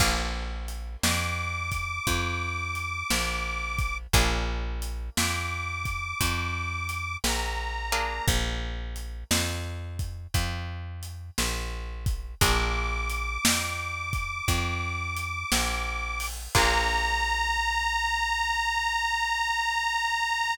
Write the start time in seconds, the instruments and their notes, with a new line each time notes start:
0.00 electric bass (finger) A#1, acoustic guitar (steel) A#3 D4 F4 G#4, kick, crash
0.68 closed hi-hat
1.03 electric bass (finger) F2, harmonica D6, snare
1.72 kick, closed hi-hat
2.07 electric bass (finger) F2, kick, closed hi-hat
2.75 closed hi-hat
3.10 electric bass (finger) A#1, snare
3.78 kick, closed hi-hat
4.13 electric bass (finger) A#1, acoustic guitar (steel) A#3 D4 F4 G#4, kick, closed hi-hat
4.82 closed hi-hat
5.17 electric bass (finger) F2, harmonica D6, snare
5.85 kick, closed hi-hat
6.20 electric bass (finger) F2, kick, closed hi-hat
6.89 closed hi-hat
7.24 electric bass (finger) A#1, harmonica A#5, snare
7.92 acoustic guitar (steel) A#3 D4 F4 G#4, closed hi-hat
8.28 electric bass (finger) A#1, kick, closed hi-hat
8.96 closed hi-hat
9.31 electric bass (finger) F2, snare
9.99 kick, closed hi-hat
10.34 electric bass (finger) F2, kick, closed hi-hat
11.03 closed hi-hat
11.38 electric bass (finger) A#1, snare
12.06 kick, closed hi-hat
12.41 electric bass (finger) A#1, acoustic guitar (steel) A#3 D4 F4 G#4, harmonica D6, kick, closed hi-hat
13.09 closed hi-hat
13.45 electric bass (finger) F2, snare
14.13 kick, closed hi-hat
14.48 electric bass (finger) F2, kick, closed hi-hat
15.17 closed hi-hat
15.52 electric bass (finger) A#1, snare
16.20 open hi-hat
16.55 electric bass (finger) A#1, acoustic guitar (steel) A#3 D4 F4 G#4, harmonica A#5, kick, crash